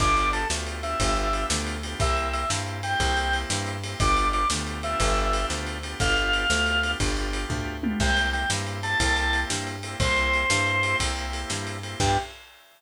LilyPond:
<<
  \new Staff \with { instrumentName = "Drawbar Organ" } { \time 12/8 \key g \major \tempo 4. = 120 d''4 a'8 r4 e''2 r4. | e''4 e''8 r4 g''2 r4. | d''4 d''8 r4 e''2 r4. | f''2. r2. |
g''4 g''8 r4 a''2 r4. | c''2.~ c''8 r2 r8 | g'4. r1 r8 | }
  \new Staff \with { instrumentName = "Drawbar Organ" } { \time 12/8 \key g \major <b d' f' g'>4. <b d' f' g'>4 <b d' f' g'>8 <b d' f' g'>2~ <b d' f' g'>8 <b d' f' g'>8 | <bes c' e' g'>4. <bes c' e' g'>4 <bes c' e' g'>8 <bes c' e' g'>2~ <bes c' e' g'>8 <bes c' e' g'>8 | <b d' f' g'>4. <b d' f' g'>4 <b d' f' g'>2. <b d' f' g'>8 | <b d' f' g'>4. <b d' f' g'>4 <b d' f' g'>8 <b d' f' g'>2~ <b d' f' g'>8 <b d' f' g'>8 |
<bes c' e' g'>4. <bes c' e' g'>4 <bes c' e' g'>8 <bes c' e' g'>2~ <bes c' e' g'>8 <bes c' e' g'>8 | <bes c' e' g'>4. <bes c' e' g'>4 <bes c' e' g'>2. <bes c' e' g'>8 | <b d' f' g'>4. r1 r8 | }
  \new Staff \with { instrumentName = "Electric Bass (finger)" } { \clef bass \time 12/8 \key g \major g,,4. d,4. g,,4. d,4. | c,4. g,4. c,4. g,4. | g,,4. d,4. g,,4. d,4. | g,,4. d,4. g,,4. d,4. |
c,4. g,4. c,4. g,4. | c,4. g,4. c,4. g,4. | g,4. r1 r8 | }
  \new DrumStaff \with { instrumentName = "Drums" } \drummode { \time 12/8 <cymc bd>8 cymr8 cymr8 sn8 cymr8 cymr8 <bd cymr>8 cymr8 cymr8 sn8 cymr8 cymr8 | <bd cymr>8 cymr8 cymr8 sn8 cymr8 cymr8 <bd cymr>8 cymr8 cymr8 sn8 cymr8 cymr8 | <bd cymr>8 cymr8 cymr8 sn8 cymr8 cymr8 <bd cymr>8 cymr8 cymr8 sn8 cymr8 cymr8 | <bd cymr>8 cymr8 cymr8 sn8 cymr8 cymr8 <bd cymr>8 cymr8 cymr8 <bd tomfh>4 tommh8 |
<cymc bd>8 cymr8 cymr8 sn8 cymr8 cymr8 <bd cymr>8 cymr8 cymr8 sn8 cymr8 cymr8 | <bd cymr>8 cymr8 cymr8 sn8 cymr8 cymr8 <bd cymr>8 cymr8 cymr8 sn8 cymr8 cymr8 | <cymc bd>4. r4. r4. r4. | }
>>